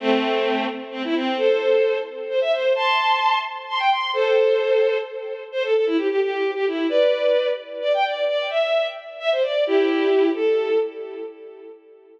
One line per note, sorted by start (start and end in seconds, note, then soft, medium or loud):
0.00 0.66 A3 medium
0.00 0.66 C4 medium
0.92 1.02 C4 medium
1.04 1.15 E4 medium
1.15 1.37 C4 medium
1.38 1.97 A4 medium
1.38 1.97 C5 medium
2.30 2.40 C5 medium
2.41 2.52 E5 medium
2.53 2.73 C5 medium
2.75 3.38 A5 medium
2.75 3.38 C6 medium
3.69 3.80 C6 medium
3.79 3.90 G5 medium
3.90 4.11 C6 medium
4.13 4.98 A4 medium
4.13 4.98 C5 loud
5.52 5.63 C5 loud
5.64 5.74 A4 medium
5.75 5.86 A4 medium
5.86 5.97 E4 medium
5.97 6.08 G4 medium
6.10 6.20 G4 medium
6.21 6.51 G4 medium
6.55 6.66 G4 medium
6.67 6.87 E4 medium
6.89 7.48 B4 medium
6.89 7.48 D5 medium
7.82 7.93 D5 medium
7.94 8.05 G5 medium
8.05 8.25 D5 medium
8.27 8.47 D5 medium
8.50 8.87 E5 medium
9.20 9.30 E5 medium
9.32 9.43 C5 medium
9.42 9.64 D5 medium
9.67 10.29 E4 medium
9.67 10.29 G4 loud
10.34 10.78 A4 medium